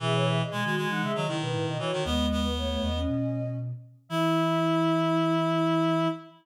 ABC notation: X:1
M:4/4
L:1/16
Q:1/4=117
K:E
V:1 name="Choir Aahs"
e c e d g2 g f e d2 B B d c2 | d3 B c c d6 z4 | e16 |]
V:2 name="Ocarina"
G2 G3 F2 D G2 E4 F2 | [G,B,]4 A, A,2 C5 z4 | E16 |]
V:3 name="Clarinet"
E,4 G, G, G,3 F, D,4 E, D, | B,2 B,6 z8 | E16 |]
V:4 name="Flute" clef=bass
B,,4 B,, D,2 E, C, D, C, B,, A,, B,, z2 | D,,6 E,,2 B,,6 z2 | E,16 |]